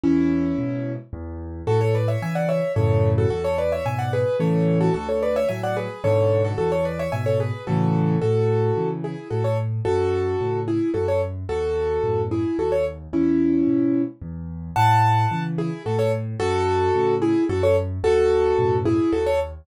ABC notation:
X:1
M:3/4
L:1/16
Q:1/4=110
K:A
V:1 name="Acoustic Grand Piano"
[CE]8 z4 | [FA] [Ac] [Bd] [ce] [eg] [df] [ce]2 [Ac]3 [FA] | [FA] [Ac] [Bd] [ce] [eg] [df] [GB]2 [Ac]3 [FA] | [FA] [Ac] [Bd] [ce] [eg] [df] [GB]2 [Ac]3 [FA] |
[FA] [Ac] [Bd] [ce] [eg] [Ac] [GB]2 [FA]4 | [FA]6 [EG]2 [FA] [Ac] z2 | [FA]6 [EG]2 [FA] [Ac] z2 | [FA]6 [EG]2 [FA] [Ac] z2 |
[CE]8 z4 | [fa]6 [EG]2 [FA] [Ac] z2 | [FA]6 [EG]2 [FA] [Ac] z2 | [FA]6 [EG]2 [FA] [Ac] z2 |]
V:2 name="Acoustic Grand Piano" clef=bass
E,,4 [G,,B,,]4 E,,4 | A,,4 [C,E,]4 [F,,A,,C,]4 | E,,4 [G,,B,,]4 [A,,C,E,]4 | D,,4 [A,,F,]4 [G,,B,,D,]4 |
E,,4 [G,,B,,]4 [A,,C,E,]4 | A,,4 [C,E,]4 A,,4 | F,,4 [A,,C,]4 F,,4 | ^D,,4 [F,,A,,B,,]4 D,,4 |
E,,4 [G,,B,,]4 E,,4 | A,,4 [C,E,]4 A,,4 | F,,4 [A,,C,]4 F,,4 | ^D,,4 [F,,A,,B,,]4 D,,4 |]